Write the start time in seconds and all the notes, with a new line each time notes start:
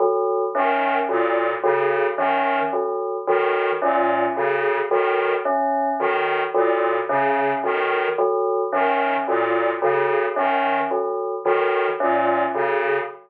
0.00 F#3
0.55 D#3 C#4
1.09 A#2 F#3
1.63 C#3 F#3
2.17 D#3 C#4
2.73 F#3
3.27 D#3 F#3
3.82 A#2 C#4
4.36 C#3 F#3
4.91 D#3 F#3
5.45 C#4
5.99 D#3 F#3
6.54 A#2 F#3
7.09 C#3 C#4
7.64 D#3 F#3
8.18 F#3
8.72 D#3 C#4
9.27 A#2 F#3
9.82 C#3 F#3
10.36 D#3 C#4
10.91 F#3
11.45 D#3 F#3
12.00 A#2 C#4
12.54 C#3 F#3